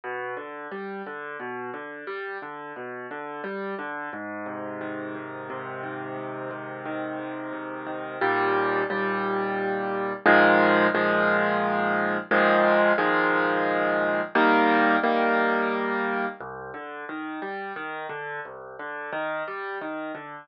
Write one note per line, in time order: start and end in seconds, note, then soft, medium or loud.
0.04 0.35 B2 medium
0.37 0.68 D3 medium
0.72 1.02 G3 medium
1.06 1.37 D3 medium
1.40 1.70 B2 medium
1.74 2.04 D3 medium
2.07 2.38 G3 medium
2.42 2.73 D3 medium
2.76 3.07 B2 medium
3.11 3.41 D3 medium
3.44 3.75 G3 medium
3.79 4.09 D3 medium
4.13 5.14 G#2 medium
4.46 5.49 C3 medium
4.81 5.83 D#3 medium
5.15 6.16 G#2 medium
5.50 6.50 C3 medium
5.83 6.85 D#3 medium
6.17 7.19 G#2 medium
6.51 7.52 C3 medium
6.86 7.86 D#3 medium
7.19 8.17 G#2 medium
7.53 8.17 C3 medium
7.87 8.19 D#3 medium
8.21 8.83 D#2 medium
8.21 8.83 A#2 medium
8.21 8.83 G3 medium
8.90 10.13 D#2 medium
8.90 10.13 A#2 medium
8.90 10.13 G3 medium
10.26 10.87 A#2 loud
10.26 10.87 D#3 loud
10.26 10.87 F3 medium
10.26 10.87 G#3 loud
10.95 12.17 A#2 medium
10.95 12.17 D#3 medium
10.95 12.17 F3 medium
10.95 12.17 G#3 medium
12.31 12.92 A#2 loud
12.31 12.92 D#3 medium
12.31 12.92 F3 medium
12.31 12.92 G#3 medium
12.98 14.21 A#2 medium
12.98 14.21 D#3 medium
12.98 14.21 F3 medium
12.98 14.21 G#3 medium
14.35 14.97 D#3 loud
14.35 14.97 G3 medium
14.35 14.97 A#3 medium
15.03 16.26 D#3 medium
15.03 16.26 G3 medium
15.03 16.26 A#3 medium
16.41 16.71 C2 medium
16.74 17.05 D3 medium
17.09 17.40 D#3 medium
17.42 17.73 G3 medium
17.76 18.07 D#3 medium
18.09 18.40 D3 medium
18.45 18.76 C2 medium
18.79 19.10 D3 medium
19.13 19.43 D#3 medium
19.48 19.78 G3 medium
19.81 20.12 D#3 medium
20.15 20.45 D3 medium